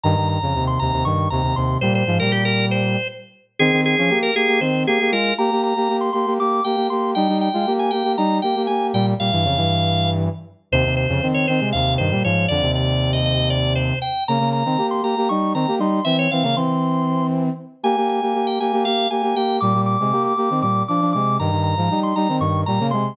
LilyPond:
<<
  \new Staff \with { instrumentName = "Drawbar Organ" } { \time 7/8 \key f \minor \tempo 4 = 118 bes''8 bes''8. c'''16 bes''8 des'''8 bes''8 c'''8 | c''16 c''8 bes'16 g'16 bes'8 c''8. r4 | aes'8 aes'8. bes'16 aes'8 c''8 aes'8 bes'8 | bes''8 bes''8. c'''16 c'''8 d'''8 g''8 c'''8 |
g''8 g''8. aes''16 g''8 bes''8 g''8 aes''8 | g''16 r16 f''2 r4 | c''8 c''8. des''16 c''8 f''8 c''8 des''8 | d''8 d''8. ees''16 ees''8 d''8 c''8 g''8 |
bes''8 bes''8. c'''16 bes''8 des'''8 bes''8 c'''8 | e''16 des''16 f''16 f''16 c'''4. r4 | aes''8 aes''8. g''16 aes''8 f''8 aes''8 g''8 | d'''8 d'''8. d'''16 d'''8 d'''8 d'''8 d'''8 |
bes''8 bes''8. c'''16 bes''8 des'''8 bes''8 c'''8 | }
  \new Staff \with { instrumentName = "Brass Section" } { \time 7/8 \key f \minor <g, ees>16 <g, ees>8 <f, des>16 <ees, c>8 <ees, c>16 <ees, c>16 <g, ees>8 <ees, c>16 <ees, c>16 <ees, c>8 | <bes, g>8 <aes, f>16 <bes, g>4.~ <bes, g>16 r4 | <ees c'>16 <ees c'>8 <f des'>16 <bes g'>8 <bes g'>16 <bes g'>16 <ees c'>8 <bes g'>16 <bes g'>16 <aes f'>8 | <bes g'>16 <bes g'>8 <bes g'>16 <bes g'>8 <bes g'>16 <bes g'>16 <bes g'>8 <bes g'>16 <bes g'>16 <bes g'>8 |
<g ees'>16 <g ees'>8 <aes f'>16 <bes g'>8 <bes g'>16 <bes g'>16 <g ees'>8 <bes g'>16 <bes g'>16 <bes g'>8 | <bes, g>8 <bes, g>16 <g, e>16 <f, des>16 <g, e>4.~ <g, e>16 r8 | <ees, c>16 <ees, c>8 <f, des>16 <ees c'>8 <ees c'>16 <c aes>16 <ees, c>8 <g, ees>16 <bes, g>16 <aes, f>8 | <f, d>16 <ees, c>2~ <ees, c>8. r8 |
<des bes>16 <des bes>8 <ees c'>16 <bes g'>8 <bes g'>16 <bes g'>16 <g ees'>8 <ees c'>16 <bes g'>16 <g ees'>8 | <e c'>8 <e c'>16 <des bes>16 <e c'>2 r8 | <bes g'>16 <bes g'>8 <bes g'>16 <bes g'>8 <bes g'>16 <bes g'>16 <bes g'>8 <bes g'>16 <bes g'>16 <bes g'>8 | <bes, g>16 <bes, g>8 <c aes>16 <bes g'>8 <bes g'>16 <ees c'>16 <bes, g>8 <f d'>16 <f d'>16 <c aes>8 |
<g, ees>16 <g, ees>8 <aes, f>16 <g ees'>8 <g ees'>16 <ees c'>16 <g, ees>8 <bes, g>16 <des bes>16 <c aes>8 | }
>>